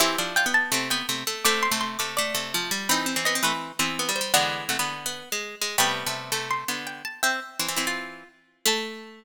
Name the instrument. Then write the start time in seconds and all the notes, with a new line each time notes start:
harpsichord
0.00 E3 C4 E4 G4 C5 E5
0.18 F3 D4
0.36 F4 G5
0.46 B3
0.54 A5
0.72 C3 A3 C4
0.90 B3 G5
1.09 C3 A3
1.27 A3
1.45 C3 A3 C4 D6
1.63 C6
1.71 C3 A3
1.81 C6
1.99 C3 A3 D6
2.17 A3 D5
2.35 C3 A3
2.54 F3
2.71 G3
2.89 E3 C4 D#4 G5 B5
3.06 C4
3.16 E3 C4
3.25 B3 D#5
3.35 C4
3.43 E3 A3 C4 B4
3.79 E3 B3 C4 C5
3.99 B3
4.09 G3
4.16 C5
4.21 G3
4.34 D3 E3 G#3 B3 D5 F#5
4.69 C3 A3 F#5
4.79 D3 B3
5.06 B3
5.32 G#3
5.61 G#3
5.78 C3 G3 A3 B3 G5 B5
6.06 C3 A3
6.32 C3 A3
6.51 C6
6.68 D3 B3
6.87 G5
7.05 A5
7.23 C4 E5 G5
7.59 E3 C4
7.68 E3 C4
7.76 E3 C4 E4
7.87 F4
8.66 A3 A5